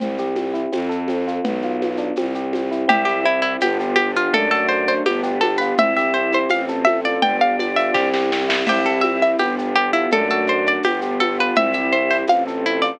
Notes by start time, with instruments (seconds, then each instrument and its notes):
0.00 violin C2, electric piano 1 C4, low conga, shaker
0.18 electric piano 1 G4, shaker
0.35 electric piano 1 C4, high conga, shaker
0.54 electric piano 1 E4, shaker
0.72 violin F2, electric piano 1 C4, tambourine, high conga, shaker
0.89 electric piano 1 A4, shaker
1.08 electric piano 1 C4, high conga, shaker
1.27 electric piano 1 F4, shaker
1.44 violin B1, electric piano 1 B3, low conga, shaker
1.62 electric piano 1 F4, shaker
1.82 electric piano 1 B3, high conga, shaker
1.97 electric piano 1 D4, shaker
2.16 violin C2, electric piano 1 C4, tambourine, high conga, shaker
2.35 electric piano 1 G4, shaker
2.53 electric piano 1 C4, high conga, shaker
2.71 electric piano 1 E4, shaker
2.88 violin C2, electric piano 1 C4, pad 2 (warm) C4 E4 G4, drawbar organ E4, harpsichord G4, low conga, shaker
3.05 harpsichord G4, electric piano 1 G4, shaker
3.24 electric piano 1 C4, harpsichord E4, shaker
3.42 harpsichord E4, electric piano 1 E4, shaker
3.60 violin G1, pad 2 (warm) B3 D4 F4 G4, electric piano 1 B3, harpsichord G4, tambourine, high conga, shaker
3.80 electric piano 1 G4, shaker
3.96 electric piano 1 B3, harpsichord G4, high conga, shaker
4.16 electric piano 1 F4, harpsichord F4, shaker
4.33 violin F#2, electric piano 1 A3, pad 2 (warm) A3 D4 F#4, drawbar organ D4, harpsichord A4, low conga, shaker
4.51 electric piano 1 F#4, harpsichord A4, shaker
4.69 electric piano 1 A3, harpsichord C5, shaker
4.87 electric piano 1 D4, harpsichord C5, shaker
5.06 violin G1, electric piano 1 B3, pad 2 (warm) B3 D4 F4 G4, harpsichord G4, tambourine, high conga, shaker
5.23 electric piano 1 G4, shaker
5.41 electric piano 1 B3, harpsichord A4, high conga, shaker
5.58 electric piano 1 F4, harpsichord B4, shaker
5.78 violin C2, pad 2 (warm) C4 E4 G4, electric piano 1 C4, drawbar organ E4, harpsichord E5, low conga, shaker
5.97 electric piano 1 G4, harpsichord E5, shaker
6.14 electric piano 1 C4, harpsichord C5, shaker
6.32 electric piano 1 E4, harpsichord C5, shaker
6.49 violin A1, electric piano 1 C4, pad 2 (warm) C4 F4 A4, harpsichord F5, tambourine, high conga, shaker
6.68 electric piano 1 A4, shaker
6.85 electric piano 1 C4, harpsichord E5, high conga, shaker
7.04 electric piano 1 F4, harpsichord D5, shaker
7.22 violin G1, pad 2 (warm) B3 D4 F4 G4, electric piano 1 B3, drawbar organ D4, harpsichord G5, low conga, shaker
7.41 electric piano 1 G4, harpsichord F5, shaker
7.59 electric piano 1 B3, harpsichord D5, high conga, shaker
7.76 electric piano 1 F4, harpsichord E5, shaker
7.94 violin C2, electric piano 1 C4, pad 2 (warm) C4 E4 G4, harpsichord G4, kick, snare
8.14 electric piano 1 G4, snare
8.32 electric piano 1 C4, snare
8.48 electric piano 1 E4, snare
8.66 violin C2, pad 2 (warm) C4 E4 G4, electric piano 1 C4, drawbar organ E4, harpsichord G4, crash, low conga, shaker
8.85 electric piano 1 G4, harpsichord A4, shaker
9.01 electric piano 1 C4, harpsichord E5, high conga, shaker
9.22 electric piano 1 E4, harpsichord E5, shaker
9.38 violin G1, electric piano 1 B3, pad 2 (warm) B3 D4 F4 G4, harpsichord G4, tambourine, high conga, shaker
9.58 electric piano 1 G4, shaker
9.76 electric piano 1 B3, harpsichord G4, shaker
9.93 harpsichord E4, electric piano 1 F4, shaker
10.11 violin F#2, electric piano 1 A3, pad 2 (warm) A3 D4 F#4, drawbar organ D4, harpsichord A4, low conga, shaker
10.30 electric piano 1 F#4, harpsichord A4, shaker
10.47 electric piano 1 A3, harpsichord C5, shaker
10.66 electric piano 1 D4, harpsichord D5, shaker
10.83 violin G1, pad 2 (warm) B3 D4 F4 G4, electric piano 1 B3, harpsichord G4, tambourine, high conga, shaker
11.01 electric piano 1 G4, shaker
11.20 electric piano 1 B3, harpsichord A4, high conga, shaker
11.39 electric piano 1 F4, harpsichord B4, shaker
11.55 violin C2, pad 2 (warm) C4 E4 G4, electric piano 1 C4, drawbar organ E4, harpsichord E5, low conga, shaker
11.73 electric piano 1 G4, harpsichord E5, shaker
11.92 electric piano 1 C4, harpsichord C5, shaker
12.10 electric piano 1 E4, harpsichord C5, shaker
12.28 violin A1, pad 2 (warm) C4 F4 A4, electric piano 1 C4, harpsichord F5, tambourine, high conga, shaker
12.47 electric piano 1 A4, shaker
12.65 electric piano 1 C4, harpsichord E4, shaker
12.82 electric piano 1 F4, harpsichord D5, shaker